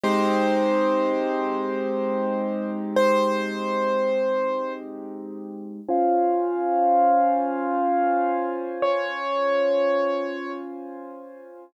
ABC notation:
X:1
M:4/4
L:1/8
Q:"Swing 16ths" 1/4=82
K:Fm
V:1 name="Acoustic Grand Piano"
c8 | c5 z3 | f8 | d5 z3 |]
V:2 name="Acoustic Grand Piano"
[A,CEG]8- | [A,CEG]8 | [DFca]8- | [DFca]8 |]